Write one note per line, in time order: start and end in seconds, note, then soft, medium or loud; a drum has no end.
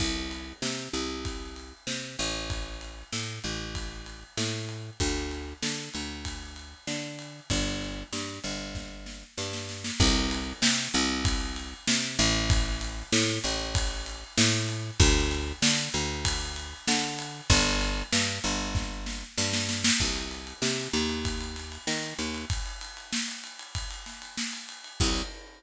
0.00 0.53 C2 medium
0.00 kick medium
0.00 crash medium
0.31 ride medium
0.62 0.89 C3 medium
0.62 snare loud
0.93 1.73 C2 medium
0.93 ride medium
1.25 kick medium
1.25 ride medium
1.56 ride medium
1.87 2.17 C3 medium
1.87 snare medium
2.19 3.04 A1 medium
2.19 ride medium
2.50 kick medium
2.50 ride medium
2.81 ride medium
3.12 3.39 A2 medium
3.12 snare medium
3.44 4.24 A1 medium
3.44 ride medium
3.75 kick medium
3.75 ride medium
4.06 ride medium
4.37 4.90 A2 medium
4.37 snare loud
4.69 ride medium
5.00 5.54 D2 medium
5.00 kick medium
5.00 ride medium
5.31 ride medium
5.62 5.89 D3 medium
5.62 snare loud
5.94 6.74 D2 medium
5.94 ride medium
6.25 kick medium
6.25 ride medium
6.56 ride medium
6.87 7.40 D3 medium
6.87 snare medium
7.19 ride medium
7.50 8.03 G1 medium
7.50 kick medium
7.50 ride medium
7.81 ride medium
8.12 8.39 G2 medium
8.12 snare medium
8.44 9.24 G1 medium
8.44 ride medium
8.75 kick medium
8.75 snare medium
9.06 snare medium
9.38 9.91 G2 medium
9.38 snare medium
9.53 snare medium
9.69 snare medium
9.84 snare medium
10.00 10.53 C2 loud
10.00 kick loud
10.00 crash loud
10.31 ride medium
10.62 10.88 C3 medium
10.62 snare loud
10.94 11.74 C2 loud
10.94 ride medium
11.25 kick loud
11.25 ride loud
11.56 ride medium
11.88 12.18 C3 medium
11.88 snare loud
12.19 13.03 A1 loud
12.19 ride medium
12.50 kick loud
12.50 ride loud
12.81 ride medium
13.12 13.39 A2 loud
13.12 snare loud
13.44 14.24 A1 loud
13.44 ride medium
13.75 kick loud
13.75 ride loud
14.06 ride medium
14.38 14.91 A2 loud
14.38 snare loud
14.69 ride medium
15.00 15.53 D2 loud
15.00 kick loud
15.00 ride loud
15.31 ride medium
15.62 15.89 D3 medium
15.62 snare loud
15.94 16.74 D2 medium
15.94 ride medium
16.25 kick medium
16.25 ride loud
16.56 ride medium
16.88 17.41 D3 loud
16.88 snare loud
17.19 ride medium
17.50 18.03 G1 loud
17.50 kick loud
17.50 ride loud
17.81 ride medium
18.12 18.39 G2 medium
18.12 snare loud
18.44 19.24 G1 loud
18.44 ride medium
18.75 kick loud
18.75 snare medium
19.06 snare medium
19.38 19.91 G2 loud
19.38 snare loud
19.53 snare loud
19.69 snare loud
19.84 snare loud
20.00 20.53 C2 medium
20.00 kick medium
20.00 crash medium
20.16 ride medium
20.31 ride medium
20.47 ride medium
20.62 20.88 C3 medium
20.62 snare loud
20.78 ride medium
20.93 21.78 D#2 loud
20.93 ride medium
21.09 ride medium
21.25 kick medium
21.25 ride loud
21.41 ride medium
21.56 snare medium
21.56 ride medium
21.72 ride medium
21.87 22.14 D#3 medium
21.87 snare loud
22.03 ride medium
22.19 22.45 D#2 medium
22.19 ride medium
22.35 ride medium
22.50 kick loud
22.50 ride loud
22.66 ride medium
22.81 ride medium
22.97 ride medium
23.12 snare loud
23.28 ride medium
23.44 ride medium
23.59 ride medium
23.75 kick medium
23.75 ride loud
23.91 ride medium
24.06 snare medium
24.06 ride medium
24.22 ride medium
24.38 snare loud
24.53 ride medium
24.69 ride medium
24.84 ride medium
25.00 25.22 C2 loud
25.00 kick loud
25.00 crash loud